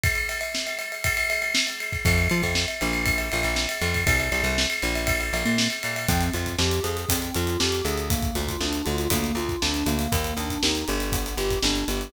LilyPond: <<
  \new Staff \with { instrumentName = "Electric Piano 2" } { \time 4/4 \key f \major \tempo 4 = 119 r1 | r1 | r1 | \key ees \major c'8 f'8 g'8 aes'8 c'8 f'8 g'8 aes'8 |
bes8 f'8 d'8 f'8 bes8 f'8 d'8 bes8~ | bes8 d'8 ees'8 g'8 b8 g'8 d'8 g'8 | }
  \new Staff \with { instrumentName = "Electric Bass (finger)" } { \clef bass \time 4/4 \key f \major r1 | f,8 f16 f,8. bes,,4 bes,,16 bes,,8. f,8 | c,8 c,16 c,8. bes,,4 bes,,16 bes,8. bes,8 | \key ees \major f,8 f,8 f,8 f,8 f,8 f,8 f,8 d,8~ |
d,8 d,8 d,8 d,8 d,8 d,8 d,8 d,8 | ees,8 ees,8 ees,8 g,,4 g,,8 g,,8 g,,8 | }
  \new DrumStaff \with { instrumentName = "Drums" } \drummode { \time 4/4 <bd cymr>16 cymr16 cymr16 cymr16 sn16 cymr16 cymr16 cymr16 <bd cymr>16 cymr16 cymr16 cymr16 sn16 cymr16 cymr16 <bd cymr>16 | <bd cymr>16 cymr16 cymr16 <bd cymr>16 sn16 cymr16 cymr16 cymr16 <bd cymr>16 cymr16 cymr16 cymr16 sn16 cymr16 cymr16 <bd cymr>16 | <bd cymr>16 cymr16 cymr16 cymr16 sn16 cymr16 cymr16 cymr16 <bd cymr>16 cymr16 cymr16 cymr16 sn16 cymr16 cymr16 cymr16 | <hh bd>16 hh16 hh16 <hh bd>16 sn16 hh16 hh16 hh16 <hh bd>16 hh16 hh16 hh16 sn16 hh16 hh16 hh16 |
<hh bd>16 <hh bd>16 hh16 <hh bd>16 sn16 hh16 hh16 hh16 <hh bd>16 hh16 hh16 <hh bd>16 sn16 hh16 hh16 hh16 | <hh bd>16 hh16 hh16 <hh bd>16 sn16 hh16 hh16 hh16 <hh bd>16 hh16 hh16 <hh bd>16 sn16 hh16 hh16 hh16 | }
>>